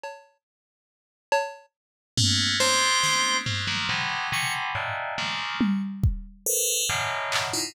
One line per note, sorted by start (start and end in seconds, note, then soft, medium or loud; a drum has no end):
0.04 cowbell medium
1.32 cowbell loud
2.18 2.56 A3 loud
2.18 2.56 A#3 loud
2.18 2.56 B3 loud
2.18 2.56 C#4 loud
2.18 floor tom medium
2.60 3.37 G#3 medium
2.60 3.37 A3 medium
2.60 3.37 B3 medium
2.60 3.37 C4 medium
2.60 3.37 D4 medium
2.60 3.37 C5 loud
2.60 cowbell medium
3.04 snare medium
3.46 3.66 F#3 medium
3.46 3.66 G#3 medium
3.46 3.66 A3 medium
3.46 3.66 A#3 medium
3.46 3.66 B3 medium
3.46 3.66 C4 medium
3.46 floor tom medium
3.67 3.87 D#3 medium
3.67 3.87 F3 medium
3.67 3.87 F#3 medium
3.67 3.87 G3 medium
3.67 3.87 A3 medium
3.67 3.87 A#3 medium
3.89 4.28 B2 medium
3.89 4.28 C3 medium
3.89 4.28 D3 medium
3.89 4.28 E3 medium
3.89 4.28 F#3 medium
3.89 4.28 G#3 medium
4.32 4.71 B2 medium
4.32 4.71 C3 medium
4.32 4.71 C#3 medium
4.32 4.71 D3 medium
4.32 4.71 E3 medium
4.32 4.53 C#6 medium
4.75 5.14 G2 medium
4.75 5.14 G#2 medium
4.75 5.14 A2 medium
4.75 5.14 A#2 medium
4.75 cowbell soft
5.18 5.57 C#3 medium
5.18 5.57 D#3 medium
5.18 5.57 F3 medium
5.18 5.57 G3 medium
5.18 5.57 A3 medium
5.18 5.57 A#3 medium
5.61 high tom medium
6.04 kick medium
6.46 6.85 A4 loud
6.46 6.85 A#4 loud
6.46 6.85 B4 loud
6.46 6.85 C5 loud
6.89 7.47 F#2 medium
6.89 7.47 G#2 medium
6.89 7.47 A2 medium
6.89 7.47 B2 medium
6.89 7.47 C#3 medium
6.89 7.47 D#3 medium
7.32 clap medium
7.53 7.73 D#4 medium
7.53 7.73 E4 medium
7.53 7.73 F4 medium